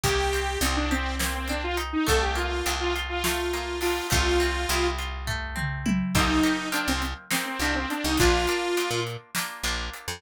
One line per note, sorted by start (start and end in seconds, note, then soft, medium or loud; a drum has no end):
0.04 0.57 C2 loud
0.04 1.19 A#3 medium
0.04 0.59 G4 loud
0.04 kick medium
0.04 closed hi-hat medium
0.33 1.49 C4 medium
0.33 closed hi-hat medium
0.61 1.95 C2 loud
0.61 0.76 C4 medium
0.61 1.77 D#4 medium
0.61 closed hi-hat loud
0.76 0.90 D4 medium
0.91 1.15 C4 medium
0.91 2.02 G4 medium
0.91 closed hi-hat medium
1.19 2.02 A#3 medium
1.19 1.34 C4 medium
1.19 snare loud
1.35 1.48 C4 medium
1.48 2.05 C4 medium
1.48 1.63 D4 medium
1.48 closed hi-hat medium
1.64 1.77 F4 medium
1.77 2.05 D#4 medium
1.77 closed hi-hat medium
1.93 2.06 D#4 medium
2.07 2.62 C2 loud
2.07 3.25 A3 medium
2.07 2.21 A4 loud
2.07 kick medium
2.07 closed hi-hat medium
2.22 2.36 G4 medium
2.35 3.53 A#3 medium
2.35 2.72 F4 medium
2.35 closed hi-hat medium
2.66 4.00 C2 medium
2.66 3.81 D4 medium
2.66 closed hi-hat medium
2.80 2.94 F4 loud
2.96 4.06 F4 medium
2.96 closed hi-hat medium
3.09 3.23 F4 medium
3.24 4.08 A3 medium
3.24 3.79 F4 medium
3.24 snare loud
3.53 4.09 A#3 medium
3.53 closed hi-hat medium
3.81 4.09 D4 medium
3.81 4.07 F4 medium
3.81 open hi-hat medium
4.10 4.66 C2 loud
4.10 5.27 A3 medium
4.10 4.87 F4 loud
4.10 kick loud
4.10 closed hi-hat medium
4.40 5.55 C4 medium
4.40 closed hi-hat medium
4.69 6.03 C2 loud
4.69 5.85 E4 medium
4.69 closed hi-hat medium
4.98 6.09 F4 medium
4.98 closed hi-hat medium
5.27 6.10 A3 medium
5.27 kick medium
5.27 floor tom medium
5.56 6.11 C4 medium
5.56 mid tom medium
5.86 6.13 E4 medium
5.86 high tom loud
6.15 6.41 C2 loud
6.15 6.42 A#3 medium
6.15 6.42 C4 medium
6.15 6.69 D#4 loud
6.15 6.42 D#4 medium
6.15 6.42 G4 medium
6.15 kick loud
6.15 crash medium
6.43 6.70 A#3 medium
6.43 6.70 C4 medium
6.43 6.70 D#4 medium
6.43 6.70 G4 medium
6.43 closed hi-hat medium
6.72 7.26 A#3 medium
6.72 7.26 C4 medium
6.72 6.87 D4 medium
6.72 7.26 D#4 medium
6.72 7.26 G4 medium
6.72 closed hi-hat medium
6.88 7.14 C2 loud
6.88 7.02 C4 medium
7.02 closed hi-hat medium
7.30 7.57 A#3 medium
7.30 7.57 C4 medium
7.30 7.46 C4 medium
7.30 7.57 D#4 medium
7.30 7.57 G4 medium
7.30 snare loud
7.46 7.60 C4 medium
7.59 7.86 C2 medium
7.59 8.15 A#3 medium
7.59 8.15 C4 medium
7.59 7.75 D4 medium
7.59 8.15 D#4 medium
7.59 8.15 G4 medium
7.59 closed hi-hat medium
7.75 7.89 C4 medium
7.90 8.04 D4 medium
7.90 closed hi-hat medium
8.04 8.17 C2 loud
8.04 8.18 D#4 medium
8.17 8.47 A#1 loud
8.17 8.46 A#3 medium
8.17 8.46 D4 medium
8.17 9.00 F4 loud
8.17 8.46 F4 medium
8.17 kick medium
8.17 closed hi-hat medium
8.47 8.75 A#3 medium
8.47 8.75 D4 medium
8.47 8.75 F4 medium
8.47 closed hi-hat medium
8.77 9.31 A#3 medium
8.77 9.31 D4 medium
8.77 9.31 F4 medium
8.77 closed hi-hat medium
8.91 9.17 A#2 medium
9.07 closed hi-hat medium
9.35 9.63 A#3 medium
9.35 9.63 D4 medium
9.35 9.63 F4 medium
9.35 snare loud
9.63 9.90 A#1 medium
9.63 10.18 A#3 medium
9.63 10.18 D4 medium
9.63 10.18 F4 medium
9.63 closed hi-hat medium
9.93 closed hi-hat medium
10.08 10.21 F2 medium